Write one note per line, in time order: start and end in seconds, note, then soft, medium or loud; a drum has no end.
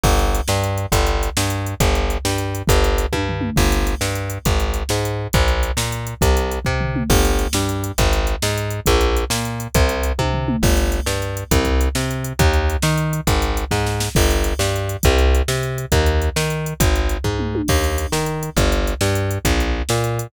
0.03 0.41 G1 loud
0.03 kick loud
0.03 crash loud
0.19 closed hi-hat medium
0.35 closed hi-hat medium
0.48 0.86 G2 loud
0.48 snare loud
0.64 closed hi-hat medium
0.78 closed hi-hat medium
0.92 1.30 G1 loud
0.92 kick loud
0.92 closed hi-hat loud
1.07 closed hi-hat medium
1.23 closed hi-hat medium
1.37 1.75 G2 medium
1.37 snare loud
1.50 closed hi-hat medium
1.66 closed hi-hat medium
1.80 2.18 G1 loud
1.80 kick loud
1.80 closed hi-hat loud
1.95 closed hi-hat medium
2.10 closed hi-hat medium
2.25 2.62 G2 medium
2.25 snare loud
2.38 closed hi-hat medium
2.55 closed hi-hat medium
2.67 3.06 G1 loud
2.67 kick loud
2.67 closed hi-hat loud
2.84 closed hi-hat medium
2.98 closed hi-hat medium
3.13 3.50 G2 medium
3.13 kick medium
3.13 high tom medium
3.29 floor tom medium
3.41 mid tom loud
3.56 3.95 G1 loud
3.56 kick loud
3.56 crash loud
3.72 closed hi-hat medium
3.87 closed hi-hat medium
4.01 4.38 G2 medium
4.01 snare loud
4.15 closed hi-hat medium
4.30 closed hi-hat medium
4.45 4.83 G#1 medium
4.45 kick loud
4.45 closed hi-hat loud
4.60 closed hi-hat medium
4.74 closed hi-hat medium
4.89 5.27 G#2 medium
4.89 snare loud
5.05 closed hi-hat medium
5.33 5.72 A#1 loud
5.33 kick loud
5.33 closed hi-hat loud
5.48 closed hi-hat medium
5.63 closed hi-hat medium
5.77 6.14 A#2 medium
5.77 snare loud
5.92 closed hi-hat medium
6.07 closed hi-hat medium
6.21 6.59 C2 loud
6.21 kick loud
6.21 closed hi-hat loud
6.37 closed hi-hat medium
6.51 closed hi-hat medium
6.65 7.03 C3 medium
6.65 kick loud
6.81 floor tom medium
6.96 mid tom loud
7.10 7.47 G1 loud
7.10 kick loud
7.10 crash loud
7.25 closed hi-hat medium
7.39 closed hi-hat medium
7.53 7.92 G2 medium
7.53 snare loud
7.69 closed hi-hat medium
7.84 closed hi-hat medium
7.98 8.36 G#1 loud
7.98 kick loud
7.98 closed hi-hat loud
8.13 closed hi-hat medium
8.27 closed hi-hat medium
8.42 8.80 G#2 loud
8.42 snare loud
8.58 closed hi-hat medium
8.70 closed hi-hat medium
8.86 9.25 A#1 loud
8.86 kick loud
8.86 closed hi-hat loud
9.01 closed hi-hat medium
9.17 closed hi-hat medium
9.30 9.68 A#2 medium
9.30 snare loud
9.45 closed hi-hat medium
9.60 closed hi-hat medium
9.74 10.12 C2 loud
9.74 kick loud
9.74 closed hi-hat loud
9.89 closed hi-hat medium
10.03 closed hi-hat medium
10.19 10.56 C3 medium
10.19 kick medium
10.19 high tom medium
10.34 floor tom medium
10.48 mid tom loud
10.63 11.00 G1 loud
10.63 kick loud
10.63 crash loud
10.77 closed hi-hat medium
10.92 closed hi-hat medium
11.06 11.44 G2 medium
11.06 snare loud
11.22 closed hi-hat medium
11.37 closed hi-hat medium
11.51 11.89 C2 loud
11.51 kick loud
11.51 closed hi-hat loud
11.65 kick medium
11.65 closed hi-hat medium
11.81 closed hi-hat medium
11.95 12.33 C3 medium
11.95 snare loud
12.11 closed hi-hat medium
12.24 closed hi-hat medium
12.39 12.77 D#2 loud
12.39 kick loud
12.39 closed hi-hat loud
12.53 closed hi-hat medium
12.70 closed hi-hat medium
12.82 13.21 D#3 medium
12.82 snare loud
12.98 closed hi-hat medium
13.13 closed hi-hat medium
13.27 13.65 G#1 loud
13.27 kick loud
13.27 closed hi-hat loud
13.42 closed hi-hat medium
13.57 closed hi-hat medium
13.71 14.09 G#2 medium
13.71 kick medium
13.71 snare medium
13.86 snare medium
14.00 snare loud
14.15 14.54 G1 loud
14.15 kick loud
14.15 crash loud
14.31 closed hi-hat medium
14.44 closed hi-hat medium
14.59 14.97 G2 loud
14.59 snare loud
14.76 closed hi-hat medium
14.89 closed hi-hat medium
15.03 15.42 C2 loud
15.03 kick loud
15.03 closed hi-hat loud
15.19 closed hi-hat medium
15.35 closed hi-hat medium
15.48 15.86 C3 medium
15.48 snare loud
15.63 closed hi-hat medium
15.78 closed hi-hat medium
15.92 16.29 D#2 loud
15.92 kick loud
15.92 closed hi-hat loud
16.06 closed hi-hat medium
16.22 closed hi-hat medium
16.36 16.74 D#3 medium
16.36 snare loud
16.50 closed hi-hat medium
16.66 closed hi-hat medium
16.80 17.18 G#1 loud
16.80 kick loud
16.80 closed hi-hat loud
16.96 closed hi-hat medium
17.09 closed hi-hat medium
17.24 17.62 G#2 medium
17.24 kick medium
17.39 mid tom medium
17.55 high tom loud
17.68 18.07 D#2 loud
17.68 kick loud
17.68 crash loud
17.84 closed hi-hat medium
17.98 closed hi-hat medium
18.12 18.50 D#3 medium
18.12 snare loud
18.26 closed hi-hat medium
18.43 closed hi-hat medium
18.56 18.94 G1 loud
18.56 kick loud
18.56 closed hi-hat loud
18.72 closed hi-hat medium
18.87 closed hi-hat medium
19.01 19.38 G2 medium
19.01 snare loud
19.15 closed hi-hat medium
19.31 closed hi-hat medium
19.45 19.82 A#1 loud
19.45 kick loud
19.45 closed hi-hat loud
19.60 closed hi-hat medium
19.89 20.27 A#2 medium
19.89 snare loud
20.04 closed hi-hat medium
20.19 closed hi-hat medium